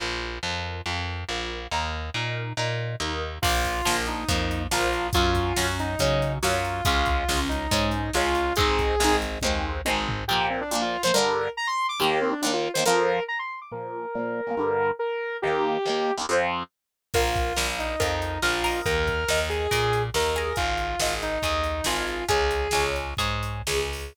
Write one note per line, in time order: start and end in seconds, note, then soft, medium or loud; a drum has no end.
0.00 0.39 A#1 medium
0.00 0.39 F4 medium
0.00 0.39 A#4 medium
0.43 0.81 F2 medium
0.43 0.82 F4 medium
0.43 0.82 A#4 medium
0.86 1.24 F2 medium
0.86 1.25 F4 medium
0.86 1.25 A#4 medium
1.29 1.67 A#1 medium
1.29 1.67 F4 medium
1.29 1.67 A#4 medium
1.71 2.10 D#2 medium
1.71 2.10 D#4 medium
1.71 2.10 A#4 medium
2.14 2.53 A#2 medium
2.14 2.53 D#4 medium
2.14 2.53 A#4 medium
2.57 2.96 A#2 medium
2.57 2.96 D#4 medium
2.57 2.96 A#4 medium
3.00 3.39 D#2 medium
3.00 3.39 D#4 medium
3.00 3.39 A#4 medium
3.42 3.81 A#1 medium
3.42 3.81 F3 medium
3.42 3.81 A#3 medium
3.42 3.96 F4 loud
3.42 kick loud
3.42 crash loud
3.64 kick medium
3.64 closed hi-hat medium
3.85 4.24 A#1 medium
3.85 4.24 F3 medium
3.85 4.24 A#3 medium
3.85 snare loud
4.06 4.62 D#4 medium
4.06 closed hi-hat medium
4.28 4.67 F2 medium
4.28 4.67 F3 medium
4.28 4.67 A#3 medium
4.28 kick loud
4.28 closed hi-hat medium
4.51 closed hi-hat medium
4.71 5.10 A#1 medium
4.71 5.10 F3 medium
4.71 5.10 A#3 medium
4.71 5.07 F4 medium
4.71 snare loud
4.93 closed hi-hat medium
5.13 5.53 F#2 medium
5.13 5.53 F#3 medium
5.13 5.53 C#4 medium
5.13 5.67 F4 medium
5.13 kick loud
5.13 closed hi-hat loud
5.35 kick medium
5.35 closed hi-hat medium
5.56 5.96 F#2 medium
5.56 5.95 F#3 medium
5.56 5.95 C#4 medium
5.56 snare loud
5.79 6.33 D#4 medium
5.79 closed hi-hat medium
5.99 6.39 C#3 medium
5.99 6.38 F#3 medium
5.99 6.38 C#4 medium
5.99 kick medium
5.99 closed hi-hat loud
6.22 closed hi-hat medium
6.43 6.81 F#2 medium
6.43 6.81 F#3 medium
6.43 6.81 C#4 medium
6.43 6.84 F4 medium
6.43 snare loud
6.65 closed hi-hat medium
6.85 7.24 C#2 medium
6.85 7.24 G#3 loud
6.85 7.24 C#4 loud
6.85 7.40 F4 medium
6.85 kick loud
6.85 closed hi-hat loud
7.06 kick medium
7.06 closed hi-hat medium
7.29 7.67 C#2 medium
7.29 7.67 G#3 medium
7.29 7.67 C#4 medium
7.29 snare loud
7.49 8.11 D#4 medium
7.49 closed hi-hat medium
7.71 8.10 G#2 medium
7.71 8.10 G#3 medium
7.71 8.10 C#4 medium
7.71 kick medium
7.71 closed hi-hat loud
7.91 closed hi-hat medium
8.13 8.53 C#2 medium
8.13 8.53 G#3 medium
8.13 8.53 C#4 medium
8.13 8.53 F4 medium
8.13 snare medium
8.35 closed hi-hat medium
8.56 8.96 G#1 medium
8.56 8.95 G#3 medium
8.56 8.95 C4 loud
8.56 9.16 G#4 loud
8.56 kick loud
8.56 closed hi-hat loud
8.60 8.95 D#4 loud
8.79 kick medium
8.79 closed hi-hat medium
9.00 9.39 G#1 medium
9.00 9.39 G#3 medium
9.00 9.39 C4 medium
9.00 snare loud
9.04 9.39 D#4 medium
9.22 closed hi-hat medium
9.41 9.81 D#2 medium
9.41 9.81 G#3 medium
9.41 9.81 C4 medium
9.41 kick medium
9.41 high tom medium
9.46 9.81 D#4 medium
9.85 10.24 G#1 medium
9.85 10.24 G#3 medium
9.85 10.24 C4 medium
9.85 high tom medium
9.90 10.24 D#4 medium
10.08 floor tom loud
10.28 10.63 A#2 medium
10.28 10.63 F3 loud
10.28 10.47 G4 medium
10.33 10.63 A#3 medium
10.50 10.60 C4 medium
10.61 10.71 D4 medium
10.71 10.97 A#2 medium
10.71 10.97 F3 medium
10.71 10.97 A#3 medium
10.71 10.82 D4 medium
10.82 11.02 F4 medium
11.03 11.12 A#2 medium
11.03 11.12 F3 medium
11.03 11.12 A#3 medium
11.03 11.14 C5 medium
11.14 11.48 G2 medium
11.14 11.48 D3 loud
11.14 11.50 A#4 medium
11.18 11.48 G3 medium
11.57 11.67 A#5 medium
11.67 11.87 C6 medium
11.89 11.99 D6 medium
12.00 12.34 D#2 medium
12.00 12.34 D#3 loud
12.00 12.34 A#3 medium
12.00 12.19 G4 medium
12.21 12.32 C4 medium
12.32 12.41 D4 medium
12.42 12.68 D#2 medium
12.42 12.68 D#3 medium
12.42 12.52 D4 medium
12.46 12.68 A#3 medium
12.53 12.71 F4 medium
12.74 12.84 D#2 medium
12.74 12.84 D#3 medium
12.74 12.84 C5 medium
12.79 12.84 A#3 medium
12.86 13.20 F2 loud
12.86 13.20 F3 loud
12.86 13.20 C4 medium
12.86 13.23 A#4 medium
13.28 13.38 A#5 medium
13.39 13.60 C6 medium
13.62 13.72 D6 medium
13.72 14.06 A#2 medium
13.72 14.06 F3 loud
13.72 14.06 A#3 loud
13.72 14.90 A#4 medium
14.15 14.41 A#2 medium
14.15 14.41 F3 medium
14.15 14.41 A#3 medium
14.47 14.55 A#2 medium
14.47 14.55 F3 medium
14.47 14.55 A#3 medium
14.57 14.91 G2 medium
14.57 14.91 D3 medium
14.57 14.91 G3 medium
14.99 15.37 A#4 medium
15.42 15.78 D#2 medium
15.42 15.78 D#3 medium
15.42 16.13 G4 medium
15.47 15.78 A#3 loud
15.86 16.11 D#2 medium
15.86 16.11 D#3 medium
15.86 16.11 A#3 medium
16.17 16.26 D#2 medium
16.17 16.26 D#3 medium
16.17 16.26 A#3 medium
16.29 16.63 F2 loud
16.29 16.63 F3 loud
16.29 16.63 C4 medium
17.14 17.53 A#1 medium
17.14 17.67 F4 medium
17.14 17.53 A#4 loud
17.14 17.53 F5 medium
17.14 kick medium
17.14 crash medium
17.36 kick medium
17.36 closed hi-hat medium
17.56 17.96 A#1 medium
17.56 17.95 A#4 medium
17.56 17.95 F5 medium
17.56 snare loud
17.79 18.40 D#4 medium
17.79 closed hi-hat medium
18.00 18.39 F2 medium
18.00 18.38 A#4 medium
18.00 18.38 F5 medium
18.00 kick medium
18.00 closed hi-hat loud
18.22 closed hi-hat medium
18.42 18.81 A#1 medium
18.42 18.80 F4 medium
18.42 18.63 A#4 medium
18.42 18.63 F5 medium
18.42 snare medium
18.64 19.24 A#4 medium
18.64 19.24 D#5 medium
18.64 open hi-hat medium
18.86 19.24 D#2 medium
18.86 19.40 A#4 medium
18.86 kick medium
18.86 closed hi-hat medium
19.07 kick medium
19.07 closed hi-hat medium
19.28 19.67 D#2 medium
19.28 19.67 A#4 medium
19.28 19.67 D#5 medium
19.28 snare loud
19.50 20.03 G#4 medium
19.50 closed hi-hat medium
19.71 20.10 A#2 medium
19.71 20.10 A#4 medium
19.71 20.10 D#5 medium
19.71 kick medium
19.71 closed hi-hat loud
19.93 closed hi-hat medium
20.14 20.53 D#2 medium
20.14 20.35 A#4 medium
20.14 20.56 A#4 medium
20.14 20.35 D#5 medium
20.14 snare medium
20.36 20.96 G#4 medium
20.36 20.96 D#5 medium
20.36 closed hi-hat medium
20.56 20.96 G#1 medium
20.56 21.14 F4 medium
20.56 kick medium
20.56 closed hi-hat medium
20.78 closed hi-hat medium
21.00 21.39 G#1 medium
21.00 21.38 G#4 medium
21.00 21.38 D#5 medium
21.00 snare loud
21.22 21.85 D#4 medium
21.22 closed hi-hat medium
21.42 21.81 D#2 medium
21.42 21.82 G#4 medium
21.42 21.82 D#5 medium
21.42 kick medium
21.42 closed hi-hat medium
21.64 closed hi-hat medium
21.84 22.24 G#1 medium
21.84 22.25 F4 medium
21.84 22.25 G#4 medium
21.84 22.25 D#5 medium
21.84 snare loud
22.07 closed hi-hat medium
22.28 22.68 C#2 medium
22.28 22.68 G#4 medium
22.28 22.84 G#4 medium
22.28 22.68 C#5 medium
22.28 kick medium
22.28 closed hi-hat loud
22.51 closed hi-hat medium
22.71 23.14 C#2 medium
22.71 23.14 G#4 medium
22.71 23.14 C#5 medium
22.71 snare loud
22.96 closed hi-hat medium
23.17 23.62 G#2 medium
23.17 23.62 G#4 medium
23.17 23.62 C#5 medium
23.17 kick medium
23.17 closed hi-hat medium
23.43 closed hi-hat medium
23.67 24.13 C#2 medium
23.67 24.13 G#4 medium
23.67 24.13 C#5 medium
23.67 snare loud
23.93 open hi-hat medium